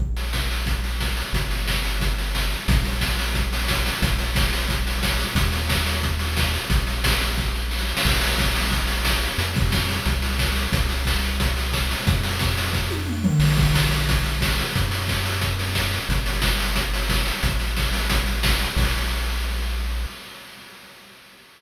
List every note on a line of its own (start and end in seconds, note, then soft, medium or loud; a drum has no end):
0.00 1.23 A#1 medium
0.00 kick medium
0.16 open hi-hat medium
0.33 kick medium
0.33 snare loud
0.51 open hi-hat medium
0.66 kick loud
0.66 closed hi-hat loud
0.84 open hi-hat medium
1.00 kick medium
1.00 snare loud
1.17 open hi-hat medium
1.33 2.56 G1 medium
1.33 kick loud
1.33 closed hi-hat loud
1.50 open hi-hat medium
1.68 kick medium
1.68 snare loud
1.84 open hi-hat medium
2.00 kick medium
2.00 closed hi-hat loud
2.18 open hi-hat medium
2.35 kick medium
2.35 snare loud
2.51 open hi-hat medium
2.68 3.91 A#1 medium
2.68 kick loud
2.68 closed hi-hat loud
2.85 open hi-hat medium
3.01 kick loud
3.01 snare loud
3.19 open hi-hat medium
3.34 kick loud
3.34 closed hi-hat loud
3.53 open hi-hat loud
3.68 kick loud
3.68 snare loud
3.86 open hi-hat loud
4.02 5.26 A#1 medium
4.02 kick loud
4.02 closed hi-hat loud
4.19 open hi-hat medium
4.35 kick loud
4.35 snare loud
4.53 open hi-hat medium
4.69 kick loud
4.69 closed hi-hat loud
4.87 open hi-hat medium
5.03 kick loud
5.03 snare loud
5.19 open hi-hat medium
5.35 6.59 D#2 medium
5.35 kick loud
5.35 closed hi-hat loud
5.52 open hi-hat medium
5.69 kick loud
5.69 snare loud
5.86 open hi-hat medium
6.03 kick medium
6.03 closed hi-hat loud
6.19 open hi-hat medium
6.37 kick loud
6.37 snare loud
6.54 open hi-hat medium
6.70 7.94 A#1 medium
6.70 kick loud
6.70 closed hi-hat loud
6.87 open hi-hat medium
7.04 kick loud
7.04 snare loud
7.21 open hi-hat medium
7.38 kick loud
7.38 snare medium
7.55 snare medium
7.71 snare medium
7.79 snare medium
7.89 snare medium
7.97 snare loud
8.05 9.28 A#1 medium
8.05 kick loud
8.05 crash loud
8.21 open hi-hat loud
8.38 kick loud
8.38 snare loud
8.55 open hi-hat loud
8.72 kick loud
8.72 closed hi-hat loud
8.87 open hi-hat loud
9.05 kick medium
9.05 snare loud
9.22 open hi-hat medium
9.38 10.00 F2 medium
9.38 closed hi-hat loud
9.54 kick loud
9.54 open hi-hat medium
9.72 kick loud
9.72 snare loud
9.89 open hi-hat medium
10.06 10.68 C2 medium
10.06 kick loud
10.06 closed hi-hat loud
10.22 open hi-hat medium
10.39 kick loud
10.39 snare loud
10.56 open hi-hat medium
10.72 11.96 C2 medium
10.72 kick loud
10.72 closed hi-hat loud
10.89 open hi-hat medium
11.05 kick loud
11.05 snare loud
11.23 open hi-hat medium
11.40 kick loud
11.40 closed hi-hat loud
11.57 open hi-hat medium
11.73 kick loud
11.73 snare loud
11.91 open hi-hat loud
12.07 13.31 F2 loud
12.07 kick loud
12.07 closed hi-hat loud
12.23 open hi-hat loud
12.39 kick loud
12.39 snare loud
12.57 open hi-hat loud
12.73 kick loud
12.73 snare medium
12.91 high tom medium
13.07 mid tom medium
13.24 floor tom loud
13.39 14.63 A#1 medium
13.39 crash loud
13.56 kick loud
13.56 open hi-hat medium
13.74 kick loud
13.74 snare loud
13.91 open hi-hat medium
14.09 kick loud
14.09 closed hi-hat loud
14.25 open hi-hat medium
14.41 kick loud
14.41 snare loud
14.58 open hi-hat medium
14.75 15.99 F#2 medium
14.75 kick loud
14.75 closed hi-hat loud
14.91 open hi-hat loud
15.08 kick medium
15.08 snare loud
15.25 open hi-hat medium
15.41 kick medium
15.41 closed hi-hat loud
15.59 open hi-hat medium
15.75 kick medium
15.75 snare loud
15.93 open hi-hat medium
16.09 17.32 G1 medium
16.09 kick loud
16.09 closed hi-hat loud
16.26 open hi-hat loud
16.42 kick loud
16.42 snare loud
16.59 open hi-hat loud
16.75 kick medium
16.75 closed hi-hat loud
16.94 open hi-hat loud
17.09 kick loud
17.09 snare loud
17.26 open hi-hat medium
17.43 18.67 A1 medium
17.43 kick loud
17.43 closed hi-hat loud
17.59 open hi-hat medium
17.77 kick medium
17.77 snare loud
17.93 open hi-hat loud
18.10 kick loud
18.10 closed hi-hat loud
18.26 open hi-hat medium
18.43 kick loud
18.43 snare loud
18.59 open hi-hat medium
18.76 20.06 A#1 loud
18.76 kick loud
18.76 crash loud